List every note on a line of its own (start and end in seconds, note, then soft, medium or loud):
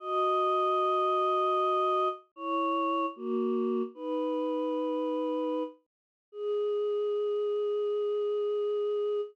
0.00 2.08 F#4 medium
0.00 2.08 D#5 medium
2.36 3.06 E4 medium
2.36 3.06 C#5 medium
3.16 3.82 A#3 medium
3.16 3.82 F#4 medium
3.95 5.63 D#4 medium
3.95 5.63 B4 medium
6.32 9.21 G#4 loud